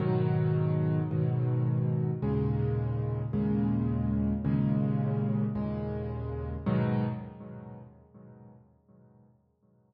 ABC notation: X:1
M:6/8
L:1/8
Q:3/8=54
K:G#m
V:1 name="Acoustic Grand Piano" clef=bass
[G,,B,,D,F,]3 [G,,B,,D,F,]3 | [D,,A,,C,G,]3 [D,,A,,C,G,]3 | [D,,A,,C,G,]3 [D,,A,,C,G,]3 | [G,,B,,D,F,]3 z3 |]